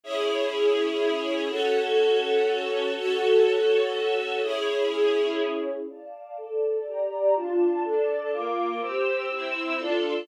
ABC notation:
X:1
M:9/8
L:1/8
Q:3/8=123
K:C#m
V:1 name="String Ensemble 1"
[CEG]9 | [CFA]9 | [CFA]9 | [CEG]9 |
[K:Dm] [dfa]3 [Ada]3 [Gdb]3 | [DFa]3 [DAa]3 [B,Fd']3 | [CGe']3 [CEe']3 [DFA]3 |]